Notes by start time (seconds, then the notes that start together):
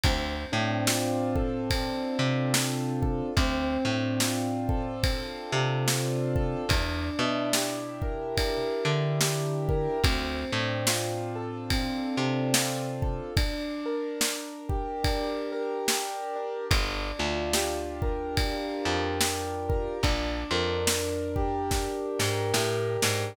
0.04 D2 C4, kick, ride
0.52 A2 D4
0.87 F4, snare
1.36 A4, kick
1.70 C4, kick, ride
2.19 C3 D4
2.54 F4, snare
3.02 A4, kick
3.37 D2 C4, kick, ride
3.85 A2 D4
4.20 F4, snare
4.69 A4, kick
5.03 C4, kick, ride
5.52 C3 D4
5.87 F4, snare
6.36 A4, kick
6.69 E2 D4, kick, ride
7.19 B2 E4
7.53 G4, snare
8.02 A#4, kick
8.37 D4, kick, ride
8.85 D3 E4
9.21 G4, snare
9.69 A#4, kick
10.04 D2 C4, kick, ride
10.52 A2 D4
10.87 F4, snare
11.36 A4
11.70 C4, kick, ride
12.17 C3 D4
12.54 F4, snare
13.02 A4, kick
13.37 D4, kick, ride
13.86 A#4
14.21 D4, snare
14.69 G4, kick
15.04 D4, kick, ride
15.52 A#4
15.87 G4, snare
16.36 D4
16.71 G1 D4, kick, ride
17.19 D2 F4
17.53 G4, snare
18.02 A#4, kick
18.37 D4, kick, ride
18.85 F2 F4
19.21 G4, snare
19.69 A#4, kick
20.03 A#1 D4, kick, ride
20.51 F2 A#4
20.87 D4, snare
21.36 G4, kick
21.71 D4, kick, snare
22.19 G#2 A#4, snare
22.54 A2 G4, snare
23.02 G#2 D4, snare